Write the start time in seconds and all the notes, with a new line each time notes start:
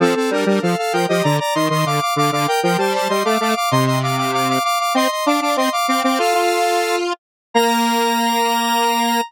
0.00 F3 C4 A4
0.16 C4 A4
0.30 G3 D4 A#4
0.46 G3 D4 A#4
0.62 F3 A4 F5
0.77 A4 F5
0.93 F3 A#4 G5
1.08 F3 G4 D#5
1.23 D3 D5 A#5
1.39 D5 A#5
1.55 D#3 D#5 C6
1.70 D#3 D#5 C6
1.86 D3 F5 D6
2.01 F5 D6
2.16 D3 F5 D6
2.32 D3 F5 D6
2.47 A#4 G5
2.63 F3 A#4 G5
2.78 G3 C5 A5
2.94 C5 A5
3.09 G3 D#5 C6
3.25 A3 F5 D6
3.40 A3 F5 D6
3.56 F5 D6
3.71 C3 D#5 C6
3.86 D#5 C6
4.03 F5 D6
4.17 F5 D6
4.33 F5 D6
4.49 F5 D6
4.64 F5 D6
4.79 F5 D6
4.94 C4 D#5 C6
5.10 D#5 C6
5.26 D4 F5 D6
5.41 D4 F5 D6
5.56 C4 D#5 C6
5.72 F5 D6
5.87 C4 F5 D6
6.03 C4 F5 D6
6.18 F4 A4 F5
6.34 F4
7.54 A#3 A#5